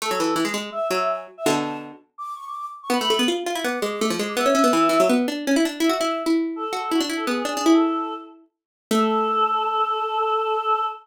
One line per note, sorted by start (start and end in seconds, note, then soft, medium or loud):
0.02 0.11 A3 medium
0.02 0.10 A4 medium
0.11 0.19 F#3 medium
0.11 0.35 A4 medium
0.20 0.35 E3 medium
0.36 0.44 E3 medium
0.45 0.53 G#3 medium
0.54 0.70 G#3 medium
0.72 0.87 E5 medium
0.91 1.27 F#3 medium
0.91 0.99 E5 medium
1.00 1.08 E5 medium
1.09 1.17 G#5 medium
1.37 1.46 E5 medium
1.46 1.92 B2 medium
1.46 1.92 D3 medium
1.46 1.55 A5 medium
1.56 1.77 A5 medium
2.18 2.34 D6 medium
2.36 2.44 C#6 medium
2.47 2.55 D6 medium
2.57 2.65 D6 medium
2.83 2.91 C#6 medium
2.90 2.98 B3 medium
2.90 3.00 B5 medium
3.01 3.10 A3 medium
3.01 3.26 B5 medium
3.10 3.19 A3 medium
3.19 3.28 B3 medium
3.28 3.44 F4 medium
3.46 3.55 F4 medium
3.55 3.64 E4 medium
3.64 3.79 B3 medium
3.64 3.79 D6 medium
3.80 4.00 G#3 medium
3.80 3.88 D6 medium
3.91 4.00 D6 medium
4.00 4.10 A3 medium
4.00 4.09 D6 medium
4.10 4.19 F3 medium
4.19 4.36 G#3 medium
4.29 4.37 D6 medium
4.37 4.45 B3 loud
4.37 5.05 E5 medium
4.46 4.54 C#4 medium
4.55 4.63 C#4 medium
4.64 4.72 B3 medium
4.73 4.89 E3 medium
4.89 4.98 E3 medium
5.00 5.08 F#3 medium
5.09 5.27 B3 medium
5.28 5.45 D4 medium
5.47 5.56 C#4 medium
5.56 5.65 E4 medium
5.65 5.80 D4 medium
5.80 5.89 E4 loud
5.80 5.92 E5 medium
5.89 5.98 F#4 medium
5.89 6.15 E5 medium
6.01 6.23 E4 medium
6.26 6.65 E4 medium
6.56 6.73 A4 medium
6.73 6.89 F#4 medium
6.73 6.82 A4 medium
6.83 6.91 A4 medium
6.92 7.00 E4 medium
6.92 7.00 F#4 medium
7.01 7.09 D4 medium
7.10 7.26 E4 medium
7.16 7.25 A4 medium
7.27 7.43 B3 medium
7.27 7.43 G#4 medium
7.45 7.54 D4 medium
7.45 7.73 G#4 medium
7.57 7.66 D4 medium
7.66 8.44 E4 medium
7.73 8.14 A4 medium
8.91 10.84 A3 loud
8.91 10.85 A4 loud